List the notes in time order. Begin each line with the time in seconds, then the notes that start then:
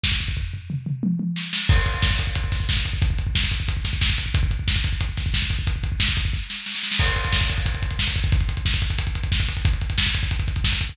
0.03 kick, snare
0.12 kick
0.20 kick
0.28 kick
0.37 kick, floor tom
0.54 floor tom
0.70 mid tom
0.86 mid tom
1.03 high tom
1.19 high tom
1.36 snare
1.53 snare
1.69 kick, crash
1.78 kick
1.86 kick, closed hi-hat
1.94 kick
2.02 kick, snare
2.11 kick
2.19 kick, closed hi-hat
2.27 kick
2.35 kick, closed hi-hat
2.44 kick
2.52 kick, snare, closed hi-hat
2.60 kick
2.69 kick, snare
2.77 kick
2.85 kick, closed hi-hat
2.93 kick
3.02 kick, closed hi-hat
3.10 kick
3.18 kick, closed hi-hat
3.27 kick
3.35 kick, snare
3.44 kick
3.51 kick, closed hi-hat
3.60 kick
3.68 kick, closed hi-hat
3.77 kick
3.85 kick, snare, closed hi-hat
3.93 kick
4.01 kick, snare
4.10 kick
4.18 kick, closed hi-hat
4.26 kick
4.34 kick, closed hi-hat
4.43 kick
4.51 kick, closed hi-hat
4.59 kick
4.68 kick, snare
4.76 kick
4.84 kick, closed hi-hat
4.93 kick
5.00 kick, closed hi-hat
5.09 kick
5.17 kick, snare, closed hi-hat
5.26 kick
5.34 kick, snare
5.42 kick
5.50 kick, closed hi-hat
5.59 kick
5.67 kick, closed hi-hat
5.76 kick
5.83 kick, closed hi-hat
5.92 kick
6.00 kick, snare
6.08 kick
6.17 kick, closed hi-hat
6.25 kick
6.33 kick, snare
6.50 snare
6.66 snare
6.75 snare
6.83 snare
6.91 snare
6.99 kick, crash
7.08 kick, closed hi-hat
7.16 kick, closed hi-hat
7.24 kick, closed hi-hat
7.32 kick, snare
7.41 kick, closed hi-hat
7.49 kick, closed hi-hat
7.57 kick, closed hi-hat
7.66 kick, closed hi-hat
7.74 kick, closed hi-hat
7.82 kick, closed hi-hat
7.90 kick, closed hi-hat
7.99 kick, snare
8.07 kick, closed hi-hat
8.15 kick, closed hi-hat
8.24 kick, closed hi-hat
8.32 kick, closed hi-hat
8.40 kick, closed hi-hat
8.49 kick, closed hi-hat
8.57 kick, closed hi-hat
8.65 kick, snare
8.74 kick, closed hi-hat
8.82 kick, closed hi-hat
8.90 kick, closed hi-hat
8.98 kick, closed hi-hat
9.07 kick, closed hi-hat
9.15 kick, closed hi-hat
9.23 kick, closed hi-hat
9.32 kick, snare
9.40 kick, closed hi-hat
9.48 kick, closed hi-hat
9.57 kick, closed hi-hat
9.65 kick, closed hi-hat
9.73 kick, closed hi-hat
9.81 kick, closed hi-hat
9.90 kick, closed hi-hat
9.98 kick, snare
10.06 kick, closed hi-hat
10.14 kick, closed hi-hat
10.23 kick, closed hi-hat
10.31 kick, closed hi-hat
10.39 kick, closed hi-hat
10.48 kick, closed hi-hat
10.56 kick, closed hi-hat
10.64 kick, snare
10.72 kick, closed hi-hat
10.81 kick, closed hi-hat
10.89 kick, closed hi-hat